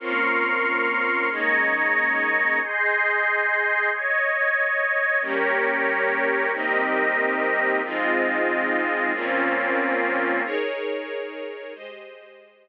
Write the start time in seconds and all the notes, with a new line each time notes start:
0.00 A#3 C4 C#4 F4 A#4 C6 C#6 F6
1.30 D#3 G#3 A#3 C#4 D#5 A#5 C#6 G#6
2.61 G#4 D#5 C6 G6
3.91 C#5 D#5 G#6
5.21 G3 A#3 C#4 G4 A#4 C#5
6.52 C3 G3 A#3 C4 D#4 G4 A#4 D#5
7.83 G#2 F3 G#3 C4 D#4 F4 D#5
9.13 A#2 F3 A#3 C4 C#4 F4
10.44 D#4 G#4 A#4 C#5
11.74 G#3 G4 C5 D#5